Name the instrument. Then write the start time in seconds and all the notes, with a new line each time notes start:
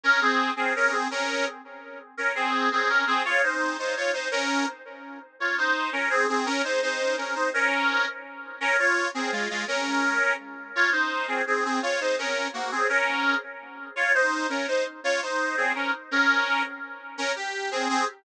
accordion
0.03 C#4 A#4
0.21 C4 G#4
0.56 C4 G#4
0.76 C#4 A#4
0.92 C4 G#4
1.11 C#4 A#4
2.17 C#4 A#4
2.35 C4 G#4
2.72 C4 G#4
2.89 C#4 A#4
3.07 C4 G#4
3.25 F4 C#5
3.43 D#4 C5
3.79 D#4 C5
3.97 F4 C#5
4.13 D#4 C5
4.31 C#4 A#4
5.40 F4 C#5
5.58 D#4 C5
5.92 C#4 A#4
6.10 C4 G#4
6.29 C4 G#4
6.46 C#4 A#4
6.64 D#4 C5
6.82 D#4 C5
7.17 C#4 A#4
7.35 D#4 C5
7.54 C#4 A#4
8.60 C#4 A#4
8.79 F4 C#5
9.14 C4 G#4
9.32 G#3 F4
9.50 G#3 F4
9.68 C#4 A#4
10.75 F4 C#5
10.92 D#4 C5
11.28 C4 G#4
11.47 C4 G#4
11.65 C4 G#4
11.82 F4 C#5
12.00 D#4 C5
12.18 C#4 A#4
12.53 A#3 F#4
12.71 C4 G#4
12.89 C#4 A#4
13.96 F4 C#5
14.14 D#4 C5
14.49 C#4 A#4
14.68 D#4 C5
15.04 F4 C#5
15.22 D#4 C5
15.57 C4 G#4
15.75 C#4 A#4
16.11 C#4 A#4
17.18 C#4 A#4
17.36 G4
17.71 C4 G#4
17.89 C4 G#4